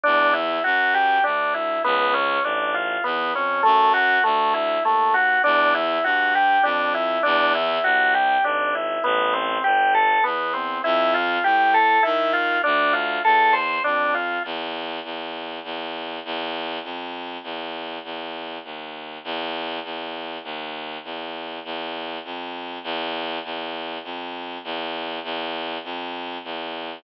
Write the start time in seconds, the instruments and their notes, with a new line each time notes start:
0.04 violin E2, drawbar organ D4
0.33 drawbar organ E4
0.64 violin F#2, drawbar organ F#4
0.94 drawbar organ G4
1.24 violin D2, drawbar organ D4
1.54 drawbar organ E4
1.84 violin C#2, drawbar organ B3
2.13 drawbar organ C#4
2.43 violin A1, drawbar organ D4
2.74 drawbar organ F4
3.04 violin E2, drawbar organ B3
3.33 violin F2, drawbar organ C#4
3.63 violin F#2, drawbar organ A3
3.94 drawbar organ F#4
4.24 violin D2, drawbar organ A3
4.54 drawbar organ E4
4.84 violin D#2, drawbar organ A3
5.14 drawbar organ F#4
5.44 violin E2, drawbar organ D4
5.75 drawbar organ E4
6.04 violin G2, drawbar organ F#4
6.35 drawbar organ G4
6.63 violin F2, drawbar organ D4
6.94 drawbar organ E4
7.23 violin E2, drawbar organ D4
7.55 drawbar organ E4
7.83 violin C2, drawbar organ F#4
8.14 drawbar organ G4
8.44 violin G#1, drawbar organ D4
8.75 drawbar organ E4
9.04 violin A1, drawbar organ B3
9.33 drawbar organ C4
9.64 violin G1, drawbar organ G4
9.94 drawbar organ A4
10.24 violin E2, drawbar organ B3
10.53 drawbar organ C4
10.84 violin F2, drawbar organ E4
11.14 drawbar organ F4
11.44 violin A2, drawbar organ G4
11.74 drawbar organ A4
12.03 violin D#3, drawbar organ E4
12.33 drawbar organ F4
12.63 violin D2, drawbar organ D4
12.93 drawbar organ F4
13.25 violin E2, drawbar organ A4
13.53 drawbar organ C5
13.84 violin F2, drawbar organ D4
14.14 drawbar organ F4
14.45 violin E2
15.04 violin E2
15.64 violin E2
16.25 violin E2
16.84 violin F2
17.43 violin E2
18.04 violin E2
18.64 violin D#2
19.24 violin E2
19.84 violin E2
20.44 violin D#2
21.04 violin E2
21.64 violin E2
22.24 violin F2
22.84 violin E2
23.44 violin E2
24.04 violin F2
24.64 violin E2
25.24 violin E2
25.84 violin F2
26.44 violin E2